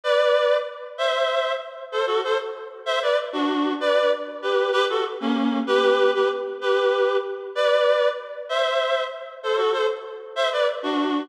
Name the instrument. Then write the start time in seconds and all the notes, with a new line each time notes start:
clarinet
0.03 B4 D5
0.98 C5 E5
1.92 A4 C5
2.06 F#4 A4
2.24 A4 C5
2.86 C5 E5
3.02 B4 D5
3.32 D4 F#4
3.80 B4 D5
4.42 G4 B4
4.72 G4 B4
4.89 F#4 A4
5.20 A#3 C#4
5.67 G4 B4
6.14 G4 B4
6.61 G4 B4
7.55 B4 D5
8.49 C5 E5
9.43 A4 C5
9.57 F#4 A4
9.72 A4 C5
10.36 C5 E5
10.52 B4 D5
10.83 D4 F#4